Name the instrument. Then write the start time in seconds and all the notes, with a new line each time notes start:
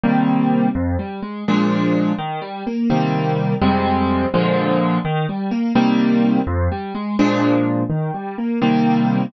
acoustic grand piano
0.04 C3 D#3 G3 A#3
0.75 F2
0.99 G3
1.23 G#3
1.48 A#2 F3 G#3 D4
2.19 D#3
2.42 G3
2.67 A#3
2.90 C3 D#3 G3 A#3
3.62 F2 C3 G3 G#3
4.34 A#2 D3 F3 G#3
5.05 D#3
5.29 G3
5.51 A#3
5.75 C3 D#3 G3 A#3
6.47 F2
6.72 G3
6.95 G#3
7.19 A#2 F3 G#3 D4
7.90 D#3
8.14 G3
8.38 A#3
8.62 C3 D#3 G3 A#3